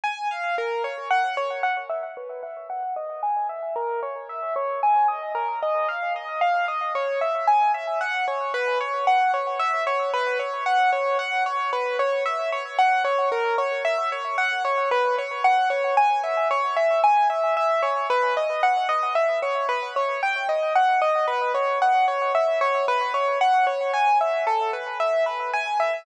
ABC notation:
X:1
M:3/4
L:1/8
Q:1/4=113
K:B
V:1 name="Acoustic Grand Piano"
g ^e | A c f c f e | B e f d g e | A c _f _d g ^d |
A d ^e d e d | c e g e f c | B c f c e c | B c f c f c |
B c e c f c | A c e c f c | B c f c g e | c e g e e c |
B d f d e c | B c =g d f d | B c f c e c | B c f c g e |
=A B e B g e |]